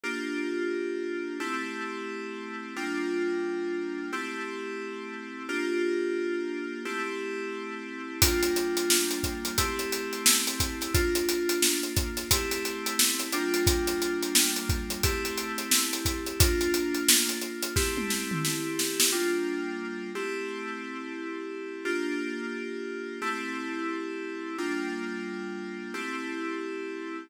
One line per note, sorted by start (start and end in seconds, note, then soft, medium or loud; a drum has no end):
0.04 1.38 A#3 medium
0.04 1.38 D4 medium
0.04 1.38 F4 medium
0.04 1.38 G4 medium
1.40 2.74 A3 medium
1.40 2.74 C4 medium
1.40 2.74 E4 medium
1.40 2.74 G4 medium
2.76 4.11 G3 medium
2.76 4.11 A#3 medium
2.76 4.11 D4 medium
2.76 4.11 F4 medium
4.12 5.47 A3 medium
4.12 5.47 C4 medium
4.12 5.47 E4 medium
4.12 5.47 G4 medium
5.49 6.83 A#3 medium
5.49 6.83 D4 medium
5.49 6.83 F4 medium
5.49 6.83 G4 medium
6.85 8.19 A3 medium
6.85 8.19 C4 medium
6.85 8.19 E4 medium
6.85 8.19 G4 medium
8.22 9.56 G3 medium
8.22 9.56 A#3 medium
8.22 9.56 D4 medium
8.22 9.56 F4 medium
8.22 kick loud
8.22 closed hi-hat loud
8.43 closed hi-hat medium
8.56 closed hi-hat medium
8.77 closed hi-hat medium
8.90 snare loud
9.11 closed hi-hat medium
9.23 kick medium
9.23 closed hi-hat medium
9.45 closed hi-hat medium
9.58 10.92 A3 medium
9.58 10.92 C4 medium
9.58 10.92 E4 medium
9.58 10.92 G4 medium
9.58 kick medium
9.58 closed hi-hat loud
9.79 closed hi-hat medium
9.92 closed hi-hat medium
10.13 closed hi-hat medium
10.26 snare loud
10.47 closed hi-hat medium
10.60 kick medium
10.60 snare soft
10.60 closed hi-hat loud
10.81 snare soft
10.81 closed hi-hat medium
10.94 12.28 A#3 medium
10.94 12.28 D4 medium
10.94 12.28 F4 medium
10.94 kick loud
10.94 closed hi-hat loud
11.15 closed hi-hat medium
11.29 closed hi-hat loud
11.49 closed hi-hat medium
11.62 snare loud
11.83 closed hi-hat medium
11.97 kick loud
11.97 closed hi-hat loud
12.17 snare soft
12.17 closed hi-hat medium
12.31 13.29 A3 medium
12.31 13.29 C4 medium
12.31 13.29 E4 medium
12.31 13.29 G4 medium
12.31 kick loud
12.31 closed hi-hat loud
12.51 snare soft
12.51 closed hi-hat medium
12.65 closed hi-hat medium
12.86 closed hi-hat medium
12.99 snare loud
13.20 closed hi-hat medium
13.33 15.01 G3 medium
13.33 15.01 A#3 medium
13.33 15.01 D4 medium
13.33 15.01 F4 medium
13.33 closed hi-hat medium
13.54 closed hi-hat medium
13.67 kick loud
13.67 closed hi-hat loud
13.87 snare soft
13.87 closed hi-hat medium
14.02 closed hi-hat medium
14.23 closed hi-hat medium
14.35 snare loud
14.56 closed hi-hat medium
14.69 kick loud
14.69 closed hi-hat medium
14.90 closed hi-hat medium
15.03 16.38 A3 medium
15.03 16.38 C4 medium
15.03 16.38 E4 medium
15.03 16.38 G4 medium
15.03 kick loud
15.03 closed hi-hat loud
15.25 closed hi-hat medium
15.38 closed hi-hat medium
15.58 closed hi-hat medium
15.71 snare loud
15.93 snare soft
15.93 closed hi-hat medium
16.05 kick medium
16.05 snare soft
16.05 closed hi-hat medium
16.26 closed hi-hat medium
16.40 17.74 A#3 medium
16.40 17.74 D4 medium
16.40 17.74 F4 medium
16.40 kick loud
16.40 closed hi-hat loud
16.61 closed hi-hat medium
16.74 closed hi-hat medium
16.95 closed hi-hat medium
17.09 snare loud
17.29 closed hi-hat medium
17.41 closed hi-hat medium
17.62 closed hi-hat medium
17.76 19.10 A3 medium
17.76 19.10 C4 medium
17.76 19.10 E4 medium
17.76 19.10 G4 medium
17.76 kick loud
17.76 snare loud
17.97 high tom medium
18.10 snare medium
18.31 mid tom medium
18.45 snare medium
18.79 snare loud
19.00 snare loud
19.12 20.11 G3 medium
19.12 20.11 A#3 medium
19.12 20.11 D4 medium
19.12 20.11 F4 medium
20.15 21.83 A3 medium
20.15 21.83 C4 medium
20.15 21.83 E4 medium
20.15 21.83 G4 medium
21.85 23.19 A#3 medium
21.85 23.19 D4 medium
21.85 23.19 F4 medium
21.85 23.19 G4 medium
23.22 24.56 A3 medium
23.22 24.56 C4 medium
23.22 24.56 E4 medium
23.22 24.56 G4 medium
24.58 25.93 G3 medium
24.58 25.93 A#3 medium
24.58 25.93 D4 medium
24.58 25.93 F4 medium
25.94 27.28 A3 medium
25.94 27.28 C4 medium
25.94 27.28 E4 medium
25.94 27.28 G4 medium